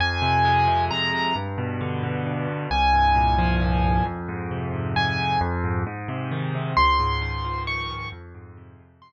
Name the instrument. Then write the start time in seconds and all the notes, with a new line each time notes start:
acoustic grand piano
0.00 F2 G#5
0.22 C3
0.45 G#3
0.67 C3
0.91 F2 A#5
1.13 C3
1.36 G2
1.58 B2
1.81 D3
2.03 B2
2.26 G2
2.48 B2
2.71 C2 G#5
2.94 G2
3.15 A#2
3.38 F3
3.61 A#2
3.84 G2
4.06 F2
4.28 G#2
4.51 C3
4.73 G#2
4.96 F2 G#5
5.19 G#2
5.41 F2
5.64 G#2
5.87 G#2
6.08 C3
6.31 D#3
6.55 C3
6.77 C#2 C6
6.99 G#2
7.22 D#3
7.45 F3
7.67 D#3 C#6
7.90 G#2
8.12 F2
8.35 G#2
8.57 C3
8.79 G#2
9.02 F2 C6